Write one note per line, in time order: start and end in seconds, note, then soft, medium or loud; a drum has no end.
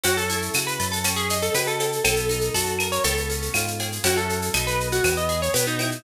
0.03 0.50 F#2 medium
0.03 0.99 C#4 loud
0.03 0.16 F#4 loud
0.03 cowbell loud
0.03 shaker loud
0.17 0.64 A4 loud
0.17 shaker medium
0.30 1.01 E4 medium
0.30 shaker medium
0.42 shaker medium
0.54 0.78 C#3 medium
0.54 1.03 F#4 medium
0.54 claves loud
0.54 shaker loud
0.67 0.90 B4 medium
0.67 shaker medium
0.80 1.50 F#2 medium
0.80 1.03 A4 medium
0.80 shaker medium
0.92 1.15 A4 loud
0.92 shaker medium
1.04 1.99 C#4 loud
1.04 cowbell medium
1.04 claves medium
1.04 shaker loud
1.16 1.38 G#4 loud
1.16 shaker medium
1.29 2.02 D#4 medium
1.29 shaker loud
1.42 1.54 A4 loud
1.42 shaker medium
1.54 1.99 C#3 medium
1.54 2.02 F#4 medium
1.54 1.66 B4 medium
1.54 cowbell medium
1.54 shaker loud
1.67 2.03 A4 medium
1.67 shaker medium
1.80 2.04 A4 medium
1.80 cowbell medium
1.80 shaker medium
1.92 shaker medium
2.04 2.50 B1 medium
2.04 3.00 B3 loud
2.04 2.49 A4 loud
2.04 cowbell loud
2.04 claves loud
2.04 shaker loud
2.16 shaker medium
2.29 3.00 D#4 medium
2.29 shaker medium
2.41 shaker medium
2.54 2.99 F#2 medium
2.54 3.02 F#4 medium
2.54 2.87 A4 loud
2.54 shaker loud
2.66 shaker medium
2.79 3.04 A#4 medium
2.79 claves loud
2.79 shaker medium
2.92 3.04 C#5 loud
2.92 shaker medium
3.04 3.49 C#2 medium
3.04 3.99 B3 loud
3.04 3.97 A4 loud
3.04 cowbell medium
3.04 shaker loud
3.17 shaker medium
3.30 4.01 C#4 medium
3.30 shaker medium
3.42 shaker medium
3.54 3.99 G#2 medium
3.54 4.02 F4 medium
3.54 cowbell medium
3.54 claves loud
3.54 shaker loud
3.67 shaker medium
3.80 4.04 G#4 medium
3.80 cowbell medium
3.80 shaker medium
3.92 shaker medium
4.04 4.50 F#2 medium
4.04 4.49 C#4 loud
4.04 4.49 E4 loud
4.04 4.49 F#4 loud
4.04 4.17 F#4 loud
4.04 4.49 A4 loud
4.04 cowbell loud
4.04 shaker loud
4.17 4.65 A4 medium
4.17 shaker medium
4.29 shaker medium
4.42 shaker medium
4.54 5.00 B1 medium
4.54 4.99 B3 loud
4.54 4.99 D#4 loud
4.54 4.99 F#4 loud
4.54 4.99 A4 loud
4.54 claves loud
4.54 shaker loud
4.67 4.88 B4 loud
4.67 shaker medium
4.80 shaker medium
4.92 5.14 F#4 loud
4.92 shaker medium
5.04 5.49 E2 medium
5.04 5.53 B3 loud
5.04 cowbell medium
5.04 claves loud
5.04 shaker loud
5.17 5.41 D#5 medium
5.17 shaker medium
5.29 6.00 G#4 medium
5.29 shaker medium
5.42 5.54 C#5 loud
5.42 shaker medium
5.54 5.99 B2 medium
5.54 6.01 B3 medium
5.54 5.66 B4 medium
5.54 cowbell medium
5.54 shaker loud
5.67 6.02 D#4 medium
5.67 shaker medium
5.79 6.03 E4 medium
5.79 cowbell medium
5.79 shaker medium
5.91 shaker medium